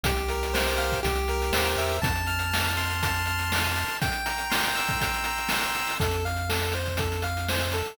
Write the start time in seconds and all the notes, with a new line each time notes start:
0.04 C2 G4, kick, closed hi-hat
0.16 closed hi-hat
0.28 A#4, closed hi-hat
0.43 closed hi-hat
0.54 C5, snare
0.68 closed hi-hat
0.77 F5, closed hi-hat
0.92 kick, closed hi-hat
1.03 C2 G4, kick, closed hi-hat
1.15 closed hi-hat
1.28 A#4, closed hi-hat
1.42 closed hi-hat
1.52 D#2 C5, snare
1.67 closed hi-hat
1.77 E2 E5, closed hi-hat
1.89 closed hi-hat
2.02 F2 A5, kick, closed hi-hat
2.15 closed hi-hat
2.26 F6, closed hi-hat
2.39 closed hi-hat
2.51 A5, snare
2.64 closed hi-hat
2.77 C6, closed hi-hat
2.90 closed hi-hat
3.02 A5, kick, closed hi-hat
3.14 closed hi-hat
3.25 F6, closed hi-hat
3.39 closed hi-hat
3.50 C6, snare
3.64 closed hi-hat
3.76 A5, closed hi-hat
3.88 closed hi-hat
4.01 G5, kick, closed hi-hat
4.12 closed hi-hat
4.26 A#5, closed hi-hat
4.38 closed hi-hat
4.50 C6, snare
4.63 closed hi-hat
4.75 E6, closed hi-hat
4.88 kick, closed hi-hat
5.00 G5, kick, closed hi-hat
5.14 closed hi-hat
5.24 A#5, closed hi-hat
5.38 closed hi-hat
5.49 C6, snare
5.63 closed hi-hat
5.74 E6, closed hi-hat
5.87 open hi-hat
6.00 F2 A4, kick, closed hi-hat
6.11 closed hi-hat
6.25 F5, closed hi-hat
6.36 closed hi-hat
6.49 A4, snare
6.62 closed hi-hat
6.72 C5, closed hi-hat
6.86 kick, closed hi-hat
6.97 A4, kick, closed hi-hat
7.12 closed hi-hat
7.22 F5, closed hi-hat
7.37 closed hi-hat
7.49 C5, snare
7.60 closed hi-hat
7.72 A4, closed hi-hat
7.85 closed hi-hat